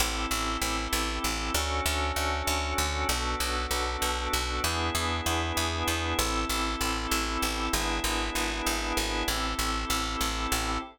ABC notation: X:1
M:5/8
L:1/8
Q:1/4=97
K:Ador
V:1 name="Drawbar Organ"
[CEGA]5 | [^CDFA]5 | [B,DFA]5 | [B,DE^G]5 |
[CEGA]5 | [B,DE^G]5 | [CEGA]5 |]
V:2 name="Electric Bass (finger)" clef=bass
A,,, A,,, A,,, A,,, A,,, | D,, D,, D,, D,, D,, | B,,, B,,, B,,, B,,, B,,, | E,, E,, E,, E,, E,, |
A,,, A,,, A,,, A,,, A,,, | ^G,,, G,,, G,,, G,,, G,,, | A,,, A,,, A,,, A,,, A,,, |]